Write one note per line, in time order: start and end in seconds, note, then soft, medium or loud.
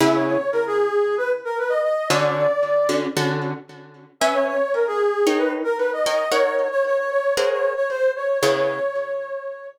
0.00 0.37 C#3 medium
0.00 0.37 B3 medium
0.00 0.37 E4 loud
0.00 0.37 G#4 medium
0.00 0.14 E5 loud
0.14 0.25 C#5 medium
0.26 0.50 C#5 medium
0.52 0.65 A#4 medium
0.67 1.15 G#4 medium
1.18 1.30 B4 medium
1.45 1.57 A#4 medium
1.58 1.71 B4 medium
1.69 1.82 D#5 medium
1.83 2.08 D#5 medium
2.09 2.47 D3 loud
2.09 2.47 C#4 loud
2.09 2.47 F#4 loud
2.09 2.47 A4 medium
2.09 2.94 D5 medium
2.89 3.07 D3 medium
2.89 3.07 C#4 medium
2.89 3.07 F#4 medium
2.89 3.07 A4 medium
3.16 3.53 D3 medium
3.16 3.53 C#4 medium
3.16 3.53 F#4 medium
3.16 3.53 A4 medium
4.20 4.58 C#4 loud
4.20 4.58 B4 medium
4.20 4.33 E5 medium
4.20 4.58 E5 loud
4.20 4.58 G#5 loud
4.33 4.46 C#5 medium
4.47 4.72 C#5 medium
4.74 4.86 A#4 medium
4.87 5.38 G#4 medium
5.27 5.63 D#4 loud
5.27 5.63 A#4 medium
5.27 5.63 C#5 loud
5.27 5.63 G5 medium
5.38 5.51 B4 medium
5.64 5.76 A#4 medium
5.78 5.91 B4 medium
5.93 6.06 D#5 medium
6.06 6.24 D#4 medium
6.06 6.24 A#4 medium
6.06 6.24 C#5 medium
6.06 6.29 D#5 medium
6.06 6.24 G5 medium
6.31 6.68 D#4 medium
6.31 6.68 A#4 loud
6.31 6.68 C#5 medium
6.31 6.54 C#5 loud
6.31 6.68 F#5 medium
6.56 6.69 C#5 medium
6.71 6.83 C#5 medium
6.86 6.98 C#5 medium
6.98 7.10 C#5 medium
7.10 7.34 C#5 medium
7.37 7.74 G#4 medium
7.37 7.74 A#4 loud
7.37 7.74 C5 loud
7.37 7.50 C#5 medium
7.37 7.74 F#5 loud
7.51 7.73 C#5 medium
7.76 7.88 C#5 medium
7.89 8.11 C5 medium
8.16 8.38 C#5 medium
8.40 8.79 C#3 loud
8.40 8.79 B3 loud
8.40 8.79 E4 medium
8.40 8.79 G#4 loud
8.40 9.67 C#5 loud